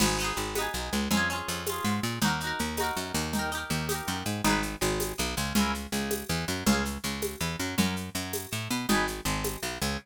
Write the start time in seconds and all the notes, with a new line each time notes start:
0.00 G#1 B3 D#4, crash, low conga, shaker
0.06 G#4
0.19 B3 D#4, shaker
0.24 G#4
0.37 G#1, shaker
0.55 B3 D#4, tambourine, high conga, shaker
0.61 G#4
0.74 B1, shaker
0.92 C#2, shaker
1.11 F2 C#4 F4, low conga, shaker
1.17 G#4
1.30 C#4 F4, shaker
1.36 G#4
1.48 F2, shaker
1.66 C#4 F4, tambourine, high conga, shaker
1.73 G#4
1.84 G#2, shaker
2.03 A#2, shaker
2.22 D#2 D#4 F#4, low conga, shaker
2.28 A#4
2.40 D#4 F#4, shaker
2.47 A#4
2.59 D#2, shaker
2.77 D#4 F#4, tambourine, high conga, shaker
2.84 A#4
2.97 F#2, shaker
3.14 D#2, shaker
3.33 D#4 G4, low conga, shaker
3.39 A#4
3.52 D#4 G4, shaker
3.58 A#4
3.70 D#2, shaker
3.89 D#4 G4, tambourine, high conga, shaker
3.95 A#4
4.07 F#2, shaker
4.25 G#2, shaker
4.44 G#1 D#4 G#4, low conga, shaker
4.50 B4
4.63 shaker
4.81 G#1 G#3, shaker
5.00 tambourine, high conga, shaker
5.18 B1 B3, shaker
5.37 C#2 C#3, shaker
5.55 C#2 C#4 E4, low conga, shaker
5.61 A#4
5.74 shaker
5.92 C#2 C#3, shaker
6.11 tambourine, high conga, shaker
6.29 E2 E3, shaker
6.48 F#2 F#3, shaker
6.66 C#2 C#4 F4, low conga, shaker
6.72 G#4
6.85 shaker
7.04 C#2 C#3, shaker
7.22 tambourine, high conga, shaker
7.41 E2 E3, shaker
7.59 F#2 F#3, shaker
7.78 F#2 C#4 F#4, low conga, shaker
7.84 A#4
7.96 shaker
8.15 F#2 F#3, shaker
8.33 tambourine, high conga, shaker
8.52 A2 A3, shaker
8.70 B2 B3, shaker
8.89 G#1 D#4 G#4, low conga, shaker
8.95 B4
9.07 shaker
9.25 G#1 G#3, shaker
9.44 tambourine, high conga, shaker
9.63 B1 B3, shaker
9.81 C#2 C#3, shaker